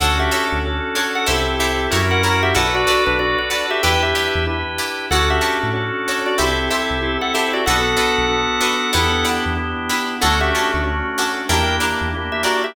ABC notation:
X:1
M:4/4
L:1/16
Q:"Swing 16ths" 1/4=94
K:Dmix
V:1 name="Drawbar Organ"
[Af] [Ge]2 z4 [Af] [Ge]2 [Ge]3 [^Af] [Af] [Ge] | [Af] [Fd]2 [DB] [Fd] [Fd]2 [Ge] [Bg] [Ge]3 z4 | [Af] [Ge]2 z4 [Fd] [Ge]2 [Ge]3 [Af] [Ge] [Fd] | [Af]12 z4 |
[Af] [Ge]2 z5 [_Bg]2 z3 [Ge] [Fd] [Ge] |]
V:2 name="Pizzicato Strings"
[DFA^c]2 [DFAc]4 [DFAc]2 [EGA=c]2 [EGAc]2 [EF^A^c]2 [EFAc]2 | [FABd]2 [FABd]4 [FABd]2 [EGBd]2 [EGBd]4 [EGBd]2 | [FA^cd]2 [FAcd]4 [FAcd]2 [EGA=c]2 [EGAc]4 [EGAc]2 | [DFAB]2 [DFAB]4 [DFAB]2 [DEGB]2 [DEGB]4 [DEGB]2 |
[^CDFA]2 [CDFA]4 [CDFA]2 [DEG_B]2 [DEGB]4 [DEGB]2 |]
V:3 name="Drawbar Organ"
[^CDFA]4 [CDFA]4 [=CEGA]4 [^CEF^A]4 | [DFAB]4 [DFAB]4 [DEGB]4 [DEGB]4 | [^CDFA]4 [CDFA]4 [=CEGA]4 [CEGA]4 | [B,DFA]4 [B,DFA]4 [B,DEG]4 [B,DEG]4 |
[A,^CDF]4 [A,CDF]4 [_B,DEG]4 [B,DEG]4 |]
V:4 name="Synth Bass 1" clef=bass
D,,3 D,,5 C,,4 F,,4 | B,,,3 B,,,5 E,,3 E,,5 | D,,3 A,,5 C,,3 C,,5 | B,,,3 B,,,5 E,,3 E,,5 |
D,,3 D,,5 E,,3 E,,5 |]